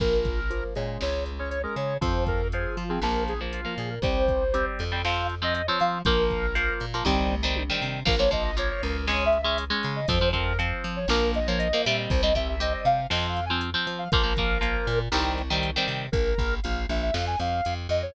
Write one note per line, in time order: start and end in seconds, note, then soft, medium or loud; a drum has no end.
0.00 0.64 A#1 medium
0.00 0.40 F3 loud
0.00 0.40 A#3 loud
0.00 0.64 A#4 medium
0.00 kick medium
0.00 crash medium
0.25 kick medium
0.25 closed hi-hat medium
0.50 0.74 F3 medium
0.50 0.74 A#3 medium
0.50 closed hi-hat medium
0.75 0.98 A#2 medium
0.75 1.31 G#3 loud
0.75 1.31 C#4 loud
0.75 closed hi-hat medium
1.01 1.66 C#2 medium
1.01 1.24 C#5 medium
1.01 snare medium
1.26 closed hi-hat medium
1.39 1.59 G#3 medium
1.39 1.59 C#4 medium
1.39 1.49 C#5 medium
1.50 1.62 C#5 medium
1.50 closed hi-hat medium
1.63 1.94 G#3 medium
1.63 1.94 C#4 medium
1.63 1.75 A#4 medium
1.76 1.98 C#3 medium
1.76 1.97 C#5 medium
1.76 closed hi-hat medium
2.01 2.66 F2 medium
2.01 2.42 F3 loud
2.01 2.42 C4 loud
2.01 2.24 C5 medium
2.01 kick loud
2.01 closed hi-hat loud
2.27 2.48 A#4 medium
2.27 kick medium
2.27 closed hi-hat medium
2.52 2.84 F3 medium
2.52 2.84 C4 medium
2.52 2.76 G#4 medium
2.52 closed hi-hat medium
2.77 2.99 F3 medium
2.77 2.89 F4 medium
2.77 closed hi-hat medium
2.89 3.00 F3 medium
2.89 3.00 C4 medium
2.89 3.01 G#4 medium
3.01 3.66 A#1 medium
3.01 3.34 F3 loud
3.01 3.34 A#3 loud
3.01 3.24 A#4 medium
3.01 snare medium
3.28 3.40 G#4 medium
3.28 closed hi-hat medium
3.41 3.61 F3 loud
3.41 3.61 A#3 medium
3.52 3.75 F4 medium
3.52 closed hi-hat medium
3.65 3.95 F3 medium
3.65 3.95 A#3 medium
3.78 3.99 A#2 medium
3.78 3.90 G#4 medium
3.78 closed hi-hat medium
3.90 4.02 A#4 medium
4.02 4.66 C2 medium
4.02 4.44 G3 loud
4.02 4.44 C4 loud
4.02 4.66 C5 medium
4.02 kick loud
4.02 closed hi-hat medium
4.28 kick medium
4.28 closed hi-hat medium
4.54 4.84 G3 medium
4.54 4.84 C4 medium
4.54 closed hi-hat loud
4.79 5.69 F2 medium
4.79 closed hi-hat medium
4.92 5.02 G3 medium
4.92 5.02 C4 medium
5.05 5.35 F3 loud
5.05 5.35 C4 loud
5.05 5.27 F5 medium
5.05 snare loud
5.29 closed hi-hat medium
5.42 5.62 F3 medium
5.42 5.62 C4 medium
5.42 5.54 D#5 medium
5.55 5.67 D#5 medium
5.55 closed hi-hat medium
5.67 5.98 F3 loud
5.67 5.98 C4 loud
5.67 5.79 C#5 medium
5.80 6.03 F3 medium
5.80 6.01 F5 medium
5.80 closed hi-hat medium
6.05 6.70 A#1 medium
6.05 6.46 F3 loud
6.05 6.46 A#3 loud
6.05 6.74 A#4 medium
6.05 kick loud
6.05 closed hi-hat medium
6.30 kick medium
6.30 closed hi-hat medium
6.55 6.85 F3 medium
6.55 6.85 A#3 loud
6.55 closed hi-hat loud
6.80 7.02 A#2 medium
6.80 closed hi-hat medium
6.94 7.04 F3 medium
6.94 7.04 A#3 medium
7.05 7.70 C2 loud
7.05 7.35 D#3 loud
7.05 7.35 G3 loud
7.05 7.35 C4 loud
7.05 kick medium
7.05 floor tom medium
7.31 mid tom medium
7.43 7.63 D#3 medium
7.43 7.63 G3 medium
7.43 7.63 C4 medium
7.56 high tom medium
7.70 8.00 D#3 medium
7.70 8.00 G3 medium
7.70 8.00 C4 medium
7.82 8.03 C3 medium
8.05 8.71 A#1 medium
8.05 8.15 F3 loud
8.05 8.15 A#3 loud
8.05 8.19 A#4 medium
8.05 kick loud
8.05 crash loud
8.19 8.29 F3 loud
8.19 8.29 A#3 loud
8.19 8.31 C#5 medium
8.31 8.51 F3 loud
8.31 8.51 A#3 medium
8.31 8.43 D#5 medium
8.31 kick medium
8.31 closed hi-hat medium
8.44 8.56 D#5 medium
8.57 8.97 F3 medium
8.57 8.97 A#3 loud
8.57 8.69 C#5 medium
8.57 closed hi-hat loud
8.70 8.82 C#5 medium
8.82 9.72 C#2 medium
8.82 9.06 A#4 medium
8.82 closed hi-hat medium
9.07 9.38 G#3 loud
9.07 9.38 C#4 loud
9.07 9.24 C#5 medium
9.07 snare loud
9.26 9.41 E5 medium
9.33 closed hi-hat medium
9.42 9.64 G#3 loud
9.42 9.64 C#4 loud
9.42 9.58 E5 medium
9.58 closed hi-hat loud
9.70 10.00 G#3 loud
9.70 10.00 C#4 loud
9.83 10.06 C#3 medium
9.83 closed hi-hat medium
9.96 10.08 D#5 medium
10.08 10.73 F2 loud
10.08 10.19 F3 loud
10.08 10.19 C4 loud
10.08 10.29 C5 medium
10.08 kick loud
10.08 closed hi-hat loud
10.21 10.31 F3 medium
10.21 10.31 C4 loud
10.33 10.53 F3 loud
10.33 10.53 C4 loud
10.33 10.58 A#4 medium
10.33 kick medium
10.33 closed hi-hat medium
10.59 10.99 F3 loud
10.59 10.99 C4 loud
10.59 closed hi-hat medium
10.84 11.06 F3 medium
10.84 closed hi-hat medium
10.96 11.08 C#5 medium
11.08 11.72 A#1 medium
11.08 11.39 F3 loud
11.08 11.39 A#3 loud
11.08 11.32 A#4 medium
11.08 snare loud
11.34 11.47 D#5 medium
11.34 closed hi-hat medium
11.47 11.68 F3 medium
11.47 11.68 A#3 medium
11.47 11.59 C#5 medium
11.59 11.82 D#5 medium
11.59 closed hi-hat loud
11.73 11.85 F3 medium
11.73 11.85 A#3 medium
11.85 12.08 A#2 medium
11.85 12.22 G3 loud
11.85 12.22 C4 loud
11.85 11.97 E5 medium
11.85 closed hi-hat medium
11.98 12.10 D#5 medium
12.09 12.75 C2 loud
12.09 12.21 C5 medium
12.09 kick loud
12.09 closed hi-hat medium
12.23 12.33 G3 loud
12.23 12.33 C4 loud
12.23 12.35 D#5 medium
12.35 12.55 G3 medium
12.35 12.55 C4 medium
12.35 12.48 E5 medium
12.35 kick medium
12.35 closed hi-hat medium
12.49 12.61 E5 medium
12.60 13.00 G3 loud
12.60 13.00 C4 loud
12.60 12.73 D#5 medium
12.60 closed hi-hat loud
12.74 12.86 D#5 medium
12.85 13.07 C3 medium
12.85 13.07 F5 medium
12.85 closed hi-hat medium
13.10 13.75 F2 medium
13.10 13.40 F3 loud
13.10 13.40 C4 loud
13.10 13.27 D#5 medium
13.10 snare loud
13.29 13.45 F5 medium
13.36 closed hi-hat medium
13.46 13.62 G#5 medium
13.50 13.70 F3 medium
13.50 13.70 C4 loud
13.61 closed hi-hat loud
13.74 14.04 F3 loud
13.74 14.04 C4 loud
13.87 14.08 F3 medium
13.87 closed hi-hat medium
13.98 14.10 F5 medium
14.12 14.77 A#1 medium
14.12 14.23 F3 loud
14.12 14.23 A#3 loud
14.12 14.99 A#4 medium
14.12 kick loud
14.12 closed hi-hat loud
14.23 14.33 F3 loud
14.23 14.33 A#3 loud
14.37 14.58 F3 loud
14.37 14.58 A#3 loud
14.37 kick medium
14.37 closed hi-hat medium
14.61 15.01 F3 medium
14.61 15.01 A#3 loud
14.61 closed hi-hat loud
14.87 15.09 A#2 medium
14.87 closed hi-hat medium
15.12 15.77 C2 medium
15.12 15.42 D#3 loud
15.12 15.42 G3 loud
15.12 15.42 C4 loud
15.12 snare loud
15.38 closed hi-hat medium
15.50 15.70 D#3 loud
15.50 15.70 G3 loud
15.50 15.70 C4 loud
15.63 closed hi-hat medium
15.76 16.06 D#3 loud
15.76 16.06 G3 loud
15.76 16.06 C4 loud
15.88 16.09 C3 medium
15.88 open hi-hat medium
16.12 16.34 A#1 medium
16.12 16.55 A#4 medium
16.12 kick loud
16.12 closed hi-hat loud
16.38 16.60 A#1 medium
16.38 kick medium
16.38 closed hi-hat medium
16.63 16.86 A#1 medium
16.63 16.87 F5 medium
16.63 closed hi-hat loud
16.89 17.11 A#1 medium
16.89 17.01 E5 medium
16.89 closed hi-hat medium
17.02 17.14 E5 medium
17.13 17.36 F2 medium
17.13 17.25 F5 medium
17.13 snare loud
17.27 17.39 G#5 medium
17.39 17.61 F2 medium
17.39 17.74 F5 medium
17.39 closed hi-hat medium
17.65 17.88 F2 medium
17.65 closed hi-hat loud
17.89 18.11 F2 medium
17.89 18.02 D#5 medium
17.89 closed hi-hat medium
18.02 18.14 C#5 medium